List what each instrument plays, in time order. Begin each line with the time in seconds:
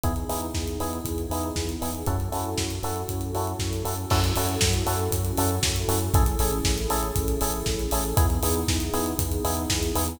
0.03 synth bass 1 E2, electric piano 1 B3 D#4 E4 G#4, pad 2 (warm) B3 D#4 E4 G#4, kick, closed hi-hat
0.16 closed hi-hat
0.29 synth bass 1 E2, electric piano 1 B3 D#4 E4 G#4, open hi-hat
0.42 closed hi-hat
0.54 synth bass 1 E2, kick, snare
0.68 closed hi-hat
0.79 synth bass 1 E2, electric piano 1 B3 D#4 E4 G#4, open hi-hat
0.93 closed hi-hat
1.05 synth bass 1 E2, kick, closed hi-hat
1.18 closed hi-hat
1.30 synth bass 1 E2, electric piano 1 B3 D#4 E4 G#4, open hi-hat
1.43 closed hi-hat
1.56 synth bass 1 E2, kick, snare
1.69 closed hi-hat
1.81 synth bass 1 E2, electric piano 1 B3 D#4 E4 G#4, open hi-hat
1.95 closed hi-hat
2.06 synth bass 1 F#2, electric piano 1 C#4 E4 F#4 A4, pad 2 (warm) C#4 E4 F#4 A4, kick, closed hi-hat
2.20 closed hi-hat
2.32 synth bass 1 F#2, electric piano 1 C#4 E4 F#4 A4, open hi-hat
2.45 closed hi-hat
2.58 synth bass 1 F#2, kick, snare
2.70 closed hi-hat
2.83 synth bass 1 F#2, electric piano 1 C#4 E4 F#4 A4, open hi-hat
2.96 closed hi-hat
3.08 synth bass 1 F#2, kick, closed hi-hat
3.21 closed hi-hat
3.33 synth bass 1 F#2, electric piano 1 C#4 E4 F#4 A4, open hi-hat
3.47 closed hi-hat
3.59 synth bass 1 F#2, kick, snare
3.73 closed hi-hat
3.84 synth bass 1 F#2, electric piano 1 C#4 E4 F#4 A4, open hi-hat
3.97 closed hi-hat
4.10 synth bass 1 F#2, pad 2 (warm) C#4 E4 F#4 A4, electric piano 1 C#4 E4 F#4 A4, kick, crash
4.24 closed hi-hat
4.35 synth bass 1 F#2, electric piano 1 C#4 E4 F#4 A4, open hi-hat
4.49 closed hi-hat
4.61 synth bass 1 F#2, kick, snare
4.74 closed hi-hat
4.86 synth bass 1 F#2, electric piano 1 C#4 E4 F#4 A4, open hi-hat
4.99 closed hi-hat
5.11 synth bass 1 F#2, kick, closed hi-hat
5.25 closed hi-hat
5.37 synth bass 1 F#2, electric piano 1 C#4 E4 F#4 A4, open hi-hat
5.51 closed hi-hat
5.62 synth bass 1 F#2, kick, snare
5.76 closed hi-hat
5.88 synth bass 1 F#2, electric piano 1 C#4 E4 F#4 A4, open hi-hat
6.01 closed hi-hat
6.14 synth bass 1 A1, pad 2 (warm) C#4 E4 G#4 A4, electric piano 1 C#4 E4 G#4 A4, kick, closed hi-hat
6.26 closed hi-hat
6.39 synth bass 1 A1, electric piano 1 C#4 E4 G#4 A4, open hi-hat
6.53 closed hi-hat
6.64 synth bass 1 A1, kick, snare
6.78 closed hi-hat
6.90 synth bass 1 A1, electric piano 1 C#4 E4 G#4 A4, open hi-hat
7.03 closed hi-hat
7.16 synth bass 1 A1, kick, closed hi-hat
7.28 closed hi-hat
7.41 synth bass 1 A1, electric piano 1 C#4 E4 G#4 A4, open hi-hat
7.54 closed hi-hat
7.66 synth bass 1 A1, kick, snare
7.79 closed hi-hat
7.91 synth bass 1 A1, electric piano 1 C#4 E4 G#4 A4, open hi-hat
8.05 closed hi-hat
8.17 synth bass 1 E2, electric piano 1 B3 D#4 E4 G#4, pad 2 (warm) B3 D#4 E4 G#4, kick, closed hi-hat
8.30 closed hi-hat
8.42 synth bass 1 E2, electric piano 1 B3 D#4 E4 G#4, open hi-hat
8.56 closed hi-hat
8.68 synth bass 1 E2, kick, snare
8.80 closed hi-hat
8.93 synth bass 1 E2, electric piano 1 B3 D#4 E4 G#4, open hi-hat
9.06 closed hi-hat
9.18 synth bass 1 E2, kick, closed hi-hat
9.32 closed hi-hat
9.44 synth bass 1 E2, electric piano 1 B3 D#4 E4 G#4, open hi-hat
9.57 closed hi-hat
9.70 synth bass 1 E2, kick, snare
9.83 closed hi-hat
9.95 synth bass 1 E2, electric piano 1 B3 D#4 E4 G#4, open hi-hat
10.08 closed hi-hat